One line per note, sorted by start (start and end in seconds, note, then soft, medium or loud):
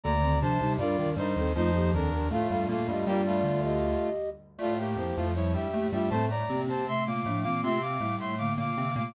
0.04 0.38 D2 loud
0.04 0.19 D3 medium
0.04 0.38 D3 loud
0.04 0.19 A#3 loud
0.04 0.39 D5 loud
0.04 0.39 A#5 loud
0.22 0.40 D#3 medium
0.22 0.40 C4 medium
0.41 0.61 C2 loud
0.41 0.61 C3 loud
0.41 0.58 F3 medium
0.41 0.58 D4 loud
0.41 0.73 C5 medium
0.41 0.73 A5 loud
0.60 0.79 C2 loud
0.60 0.79 C3 loud
0.60 0.77 G3 medium
0.60 0.77 D#4 loud
0.78 0.96 G2 loud
0.78 0.96 G3 loud
0.78 0.97 D4 medium
0.78 1.10 F4 medium
0.78 0.97 A#4 loud
0.78 1.10 D5 loud
0.98 1.16 D#2 loud
0.98 1.16 D#3 loud
0.98 1.15 D4 medium
0.98 1.15 A#4 medium
1.16 1.34 G2 loud
1.16 1.34 G3 loud
1.16 1.35 D4 medium
1.16 1.52 D#4 medium
1.16 1.35 A#4 medium
1.16 1.52 C5 medium
1.36 1.54 D#2 medium
1.36 1.54 D#3 loud
1.36 1.53 C4 medium
1.36 1.53 A4 medium
1.55 1.92 F2 loud
1.55 1.92 F3 loud
1.55 1.71 A3 medium
1.55 1.90 D#4 medium
1.55 1.71 F4 loud
1.55 1.90 C5 loud
1.74 1.93 A#3 medium
1.74 1.93 G4 medium
1.93 2.11 D#2 medium
1.93 2.11 D#3 loud
1.93 2.10 C4 medium
1.93 2.28 D4 medium
1.93 2.10 A4 medium
1.93 2.28 A#4 medium
2.12 2.29 D#2 medium
2.12 2.29 D#3 loud
2.12 2.29 D4 medium
2.12 2.29 A#4 medium
2.30 2.48 A2 medium
2.30 2.48 A3 loud
2.30 2.68 A3 medium
2.30 2.68 F4 medium
2.30 2.47 A4 medium
2.30 2.47 F5 medium
2.50 2.67 G2 medium
2.50 2.67 G3 loud
2.50 2.66 A4 medium
2.50 2.66 F5 medium
2.68 2.87 A#2 medium
2.68 3.05 A3 medium
2.68 2.87 A#3 loud
2.68 3.05 F4 medium
2.68 2.87 A4 medium
2.68 2.87 F5 medium
2.88 3.04 G2 loud
2.88 3.04 G3 loud
2.88 3.07 G4 medium
2.88 3.07 D#5 medium
3.06 3.42 G2 loud
3.06 3.42 G3 loud
3.06 3.22 A#3 medium
3.06 3.62 F4 medium
3.06 3.22 G4 loud
3.06 3.62 D5 loud
3.26 4.09 A3 medium
3.26 4.09 F4 medium
3.44 3.94 D2 loud
3.44 3.94 D3 loud
3.63 4.30 G4 medium
3.63 4.30 D#5 medium
4.58 4.95 A2 loud
4.58 4.95 A3 loud
4.58 4.78 A3 medium
4.58 4.74 F4 medium
4.58 4.78 F4 loud
4.58 4.74 D5 medium
4.78 5.16 A#3 medium
4.78 5.16 G4 medium
4.96 5.11 F2 medium
4.96 5.11 F3 loud
4.96 5.28 E4 medium
4.96 5.28 C5 medium
5.16 5.54 F2 loud
5.16 5.54 F3 loud
5.16 5.33 A3 medium
5.16 5.33 F4 medium
5.35 5.68 G3 medium
5.35 5.53 E4 medium
5.35 5.68 E4 medium
5.35 5.53 C#5 medium
5.54 5.70 G2 medium
5.54 5.70 G3 medium
5.54 5.87 G4 medium
5.54 5.87 E5 medium
5.73 5.90 A2 loud
5.73 5.90 A3 loud
5.73 5.91 A#3 medium
5.73 5.91 G4 medium
5.92 6.09 G2 medium
5.92 6.09 G3 loud
5.92 6.09 A3 medium
5.92 6.09 F4 medium
5.92 6.09 G4 medium
5.92 6.09 E5 medium
6.10 6.43 A2 loud
6.10 6.43 A3 loud
6.10 6.29 C4 medium
6.10 6.29 A4 medium
6.10 6.25 C5 medium
6.10 6.25 A5 medium
6.30 6.61 D5 medium
6.30 6.61 A#5 medium
6.49 6.67 C3 medium
6.49 6.85 A#3 medium
6.49 6.67 C4 medium
6.49 6.85 G4 medium
6.67 7.02 C3 medium
6.67 7.02 C4 medium
6.67 6.86 C5 medium
6.67 6.86 A5 medium
6.88 7.24 C3 medium
6.88 7.24 A3 medium
6.88 7.04 E5 medium
6.88 7.04 C6 loud
7.06 7.26 A#2 medium
7.06 7.26 A#3 loud
7.06 7.40 F5 medium
7.06 7.40 D6 medium
7.26 7.44 A2 medium
7.26 7.44 F3 medium
7.26 7.44 A3 loud
7.26 7.44 D4 medium
7.43 7.63 A#2 medium
7.43 7.62 E3 medium
7.43 7.63 A#3 loud
7.43 7.62 C4 medium
7.43 7.61 F5 medium
7.43 7.61 D6 medium
7.63 7.97 C3 loud
7.63 7.79 A3 medium
7.63 7.97 C4 loud
7.63 7.79 F4 medium
7.63 7.81 E5 medium
7.63 7.81 C6 medium
7.82 8.16 F5 medium
7.82 8.16 D6 medium
8.00 8.16 A2 medium
8.00 8.35 G3 medium
8.00 8.16 A3 medium
8.00 8.35 E4 medium
8.18 8.50 A2 medium
8.18 8.50 A3 loud
8.18 8.35 E5 medium
8.18 8.35 C6 medium
8.38 8.72 D3 medium
8.38 8.72 A#3 medium
8.38 8.53 F5 medium
8.38 8.53 D6 medium
8.57 8.74 A#2 medium
8.57 8.74 A#3 loud
8.57 8.94 F5 medium
8.57 8.94 D6 medium
8.77 8.94 C3 medium
8.77 8.97 D3 medium
8.77 8.97 A#3 medium
8.77 8.94 C4 loud
8.96 9.12 A#2 loud
8.96 9.12 C3 medium
8.96 9.12 A3 medium
8.96 9.12 A#3 loud
8.96 9.14 F5 medium
8.96 9.14 D6 medium